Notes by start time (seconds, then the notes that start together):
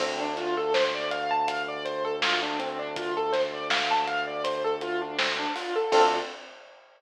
0.00 D2 C4, kick, crash
0.20 D4
0.37 F4, snare, closed hi-hat
0.57 A4
0.74 C5, snare
0.94 D5
1.11 F5, closed hi-hat
1.31 A5
1.48 F5, kick, closed hi-hat
1.68 D5
1.85 C5, closed hi-hat
2.05 A4
2.22 F4, snare
2.43 D4
2.59 C4, closed hi-hat
2.79 D4
2.96 F4, kick, closed hi-hat
3.17 A4
3.33 C5, snare, closed hi-hat
3.53 D5
3.70 F5, snare
3.91 A5
4.07 F5, closed hi-hat
4.27 D5
4.44 C5, kick, closed hi-hat
4.64 A4
4.81 F4, closed hi-hat
5.02 D4
5.19 C4, snare
5.39 D4
5.55 F4, open hi-hat
5.76 A4
5.92 D2 C4 D4 F4 A4, kick, crash